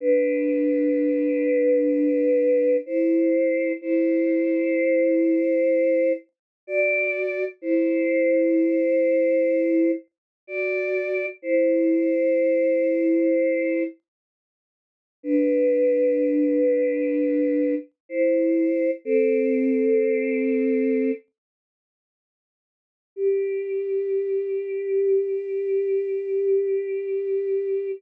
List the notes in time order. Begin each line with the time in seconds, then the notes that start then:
0.01 D4 B4
2.86 E4 C5
3.81 E4 C5
6.67 F#4 D5
7.62 E4 C5
10.47 F#4 D5
11.42 E4 C5
15.23 D4 B4
18.09 E4 C5
19.05 C4 A4
23.16 G4